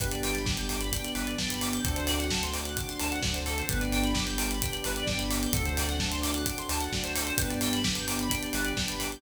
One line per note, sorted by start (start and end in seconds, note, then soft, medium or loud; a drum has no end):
0.00 0.98 G1 medium
0.00 0.42 B3 medium
0.00 0.42 D4 medium
0.00 0.42 G4 loud
0.00 0.11 B4 loud
0.00 kick medium
0.00 closed hi-hat medium
0.11 0.22 D5 medium
0.11 closed hi-hat medium
0.23 0.34 G5 medium
0.23 open hi-hat medium
0.34 0.45 B5 medium
0.34 snare soft
0.34 closed hi-hat medium
0.45 0.88 B3 medium
0.45 0.88 D4 medium
0.45 0.88 G4 medium
0.45 0.56 D6 medium
0.45 kick medium
0.45 snare medium
0.57 0.68 G6 medium
0.57 closed hi-hat medium
0.69 0.80 D6 medium
0.69 open hi-hat medium
0.81 0.91 B5 medium
0.81 closed hi-hat medium
0.92 1.33 B3 medium
0.92 1.33 D4 medium
0.92 1.33 G4 medium
0.92 1.04 G5 loud
0.92 kick medium
0.92 closed hi-hat medium
1.04 1.15 D5 medium
1.04 closed hi-hat medium
1.15 1.35 G1 medium
1.15 1.25 B4 medium
1.15 open hi-hat medium
1.27 1.37 D5 medium
1.27 closed hi-hat medium
1.38 1.79 G1 medium
1.38 1.80 B3 medium
1.38 1.80 D4 medium
1.38 1.80 G4 medium
1.38 1.49 G5 loud
1.38 kick medium
1.38 snare medium
1.50 1.61 B5 medium
1.50 closed hi-hat medium
1.61 1.73 D6 medium
1.61 open hi-hat medium
1.72 1.83 G6 medium
1.72 closed hi-hat medium
1.84 2.82 D2 loud
1.84 2.26 A3 medium
1.84 2.26 C4 loud
1.84 2.26 D4 medium
1.84 2.26 F#4 medium
1.84 1.95 A4 loud
1.84 kick medium
1.84 closed hi-hat medium
1.96 2.07 C5 medium
1.96 closed hi-hat medium
2.07 2.17 D5 medium
2.07 open hi-hat medium
2.19 2.30 F#5 medium
2.19 snare soft
2.19 closed hi-hat medium
2.30 2.72 A3 medium
2.30 2.72 C4 medium
2.30 2.72 D4 medium
2.30 2.72 F#4 medium
2.30 2.41 A5 loud
2.30 kick medium
2.30 snare loud
2.43 2.53 C6 medium
2.43 closed hi-hat medium
2.53 2.63 D6 medium
2.53 open hi-hat medium
2.65 2.77 F#6 medium
2.65 closed hi-hat medium
2.77 3.18 A3 medium
2.77 3.18 C4 medium
2.77 3.18 D4 medium
2.77 3.18 F#4 medium
2.77 2.88 D6 loud
2.77 kick medium
2.77 closed hi-hat medium
2.88 2.99 C6 medium
2.88 closed hi-hat medium
3.00 3.20 D2 medium
3.00 3.10 A5 medium
3.00 open hi-hat medium
3.11 3.21 F#5 medium
3.11 closed hi-hat medium
3.22 3.62 D2 medium
3.22 3.64 A3 medium
3.22 3.64 C4 medium
3.22 3.64 D4 medium
3.22 3.64 F#4 medium
3.22 3.34 D5 loud
3.22 kick medium
3.22 snare loud
3.34 3.45 C5 medium
3.34 closed hi-hat medium
3.46 3.56 A4 medium
3.46 open hi-hat medium
3.58 3.69 C5 medium
3.58 closed hi-hat medium
3.69 4.67 G1 loud
3.69 4.11 B3 loud
3.69 4.11 D4 medium
3.69 4.11 G4 medium
3.69 3.80 B4 loud
3.69 kick medium
3.69 closed hi-hat medium
3.81 3.92 D5 medium
3.81 closed hi-hat medium
3.92 4.02 G5 medium
3.92 open hi-hat medium
4.04 4.14 B5 medium
4.04 snare soft
4.04 closed hi-hat medium
4.14 4.57 B3 medium
4.14 4.57 D4 medium
4.14 4.57 G4 medium
4.14 4.25 D6 loud
4.14 kick medium
4.14 snare loud
4.26 4.36 G6 medium
4.26 closed hi-hat medium
4.38 4.48 D6 medium
4.38 open hi-hat medium
4.51 4.61 B5 medium
4.51 closed hi-hat medium
4.62 5.04 B3 medium
4.62 5.04 D4 medium
4.62 5.04 G4 medium
4.62 4.72 G5 medium
4.62 kick medium
4.62 closed hi-hat medium
4.72 4.82 D5 medium
4.72 closed hi-hat medium
4.84 5.04 G1 medium
4.84 4.96 B4 medium
4.84 open hi-hat medium
4.96 5.08 D5 medium
4.96 closed hi-hat medium
5.06 5.47 G1 medium
5.06 5.49 B3 medium
5.06 5.49 D4 medium
5.06 5.49 G4 medium
5.06 5.17 G5 loud
5.06 kick medium
5.06 snare medium
5.18 5.29 B5 loud
5.18 closed hi-hat medium
5.30 5.41 D6 medium
5.30 open hi-hat medium
5.42 5.53 G6 medium
5.42 closed hi-hat medium
5.53 6.51 D2 loud
5.53 5.95 A3 loud
5.53 5.95 C4 medium
5.53 5.95 D4 medium
5.53 5.95 F#4 loud
5.53 5.64 A4 loud
5.53 kick loud
5.53 closed hi-hat medium
5.65 5.76 C5 medium
5.65 closed hi-hat medium
5.77 5.88 D5 medium
5.77 open hi-hat medium
5.89 5.99 F#5 medium
5.89 snare medium
5.89 closed hi-hat medium
6.00 6.42 A3 medium
6.00 6.42 C4 medium
6.00 6.42 D4 medium
6.00 6.42 F#4 medium
6.00 6.10 A5 loud
6.00 kick medium
6.00 snare loud
6.11 6.22 C6 medium
6.11 closed hi-hat medium
6.22 6.32 D6 medium
6.22 open hi-hat medium
6.34 6.45 F#6 medium
6.34 closed hi-hat medium
6.46 6.88 A3 medium
6.46 6.88 C4 medium
6.46 6.88 D4 medium
6.46 6.88 F#4 medium
6.46 6.56 D6 loud
6.46 kick medium
6.46 closed hi-hat medium
6.58 6.69 C6 medium
6.58 closed hi-hat medium
6.69 6.88 D2 medium
6.69 6.80 A5 medium
6.69 open hi-hat medium
6.80 6.91 F#5 medium
6.80 closed hi-hat medium
6.92 7.32 D2 medium
6.92 7.34 A3 medium
6.92 7.34 C4 medium
6.92 7.34 D4 medium
6.92 7.34 F#4 medium
6.92 7.04 D5 medium
6.92 kick medium
6.92 snare medium
7.04 7.15 C5 medium
7.04 closed hi-hat medium
7.15 7.26 A4 medium
7.15 open hi-hat medium
7.26 7.36 C5 medium
7.26 closed hi-hat medium
7.38 8.36 G1 medium
7.38 7.80 B3 medium
7.38 7.80 D4 loud
7.38 7.80 G4 medium
7.38 7.49 B4 loud
7.38 kick medium
7.38 closed hi-hat loud
7.50 7.60 D5 medium
7.50 closed hi-hat medium
7.61 7.72 G5 medium
7.61 open hi-hat medium
7.73 7.84 B5 medium
7.73 snare medium
7.73 closed hi-hat medium
7.84 8.26 B3 medium
7.84 8.26 D4 medium
7.84 8.26 G4 medium
7.84 7.95 D6 medium
7.84 kick medium
7.84 snare loud
7.95 8.07 G6 medium
7.95 closed hi-hat medium
8.07 8.17 D6 loud
8.07 open hi-hat medium
8.19 8.31 B5 medium
8.19 closed hi-hat medium
8.30 8.72 B3 medium
8.30 8.72 D4 medium
8.30 8.72 G4 medium
8.30 8.41 G5 loud
8.30 kick medium
8.30 closed hi-hat medium
8.43 8.53 D5 medium
8.43 closed hi-hat medium
8.53 8.73 G1 medium
8.53 8.65 B4 medium
8.53 open hi-hat medium
8.65 8.75 D5 medium
8.65 closed hi-hat medium
8.76 9.16 G1 medium
8.76 9.18 B3 medium
8.76 9.18 D4 medium
8.76 9.18 G4 medium
8.76 8.87 G5 medium
8.76 kick medium
8.76 snare loud
8.88 8.99 B5 medium
8.88 closed hi-hat medium
9.00 9.10 D6 medium
9.00 open hi-hat medium
9.11 9.21 G6 medium
9.11 closed hi-hat medium